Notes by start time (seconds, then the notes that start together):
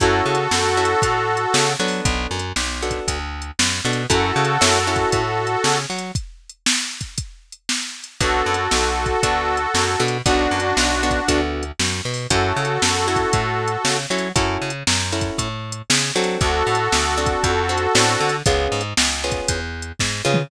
0.00 F#2 C#4 E4 F#4 A4, kick, closed hi-hat
0.26 C#3
0.35 closed hi-hat
0.51 F#2, snare
0.77 C#4 E4 F#4 A4
0.85 closed hi-hat
1.02 A2, kick, closed hi-hat
1.37 closed hi-hat
1.54 C#3, snare
1.79 F#3 B3 D4 F#4 A4
1.88 open hi-hat
2.05 B1, kick, closed hi-hat
2.31 F#2
2.39 closed hi-hat
2.56 B1, snare
2.82 B3 D4 F#4 A4
2.91 kick, closed hi-hat
3.08 D2, kick, closed hi-hat
3.42 closed hi-hat
3.59 F#2, snare
3.85 B2 B3 D4 F#4 A4
3.93 closed hi-hat
4.10 F#2 C#4 E4 F#4 A4, kick, closed hi-hat
4.36 C#3
4.45 closed hi-hat
4.61 F#2 C#4 E4 F#4 A4, snare
4.87 C#4 E4 F#4 A4
4.96 kick, closed hi-hat
5.12 A2, kick, closed hi-hat
5.47 closed hi-hat
5.64 C#3, snare
5.90 F#3
5.99 closed hi-hat
6.15 kick, closed hi-hat
6.49 closed hi-hat
6.66 snare
7.01 kick, closed hi-hat
7.18 kick, closed hi-hat
7.52 closed hi-hat
7.69 snare
8.04 closed hi-hat
8.20 B1 B3 D4 F#4 A4, kick, closed hi-hat
8.46 F#2
8.54 closed hi-hat
8.71 B1, snare
9.06 kick, closed hi-hat
9.23 D2 B3 D4 F#4 A4, kick, closed hi-hat
9.57 closed hi-hat
9.74 F#2, snare
10.00 B2 B3 D4 F#4 A4
10.08 closed hi-hat
10.26 B1 B3 D4 F#4 A4, kick, closed hi-hat
10.51 F#2
10.60 closed hi-hat
10.77 B1, snare
11.03 B3 D4 F#4 A4
11.11 kick, closed hi-hat
11.28 D2 B3 D4 F#4 A4, kick, closed hi-hat
11.63 closed hi-hat
11.79 F#2, snare
12.05 B2
12.14 open hi-hat
12.30 F#2 C#4 E4 F#4 A4, kick, closed hi-hat
12.56 C#3
12.65 closed hi-hat
12.82 F#2, snare
13.08 C#4 E4 F#4 A4
13.16 kick, closed hi-hat
13.33 A2, kick, closed hi-hat
13.68 closed hi-hat
13.85 C#3, snare
14.10 F#3 C#4 E4 F#4 A4
14.18 closed hi-hat
14.36 F#2 C#4 E4 F#4 A4, kick, closed hi-hat
14.62 C#3
14.70 closed hi-hat
14.87 F#2, snare
15.12 C#4 E4 F#4 A4
15.21 kick, closed hi-hat
15.38 A2, kick, closed hi-hat
15.72 closed hi-hat
15.90 C#3, snare
16.15 F#3 C4 D4 F#4 A4
16.24 closed hi-hat
16.41 D2 F#4 A4, kick, closed hi-hat
16.67 A2
16.75 closed hi-hat
16.92 D2, snare
17.18 C4 D4 F#4 A4
17.26 kick, closed hi-hat
17.44 F2, kick, closed hi-hat
17.69 C4 D4 F#4 A4
17.78 closed hi-hat
17.95 A2 C4 D4 F#4 A4, snare
18.21 D3
18.29 closed hi-hat
18.46 C#2 B3 C#4 F4 G#4, kick, closed hi-hat
18.72 G#2
18.81 closed hi-hat
18.97 C#2, snare
19.24 B3 C#4 F4 G#4
19.32 kick, closed hi-hat
19.48 E2, kick, closed hi-hat
19.82 closed hi-hat
19.99 G#2, kick, snare
20.25 C#3 B3 C#4 F4 G#4
20.34 mid tom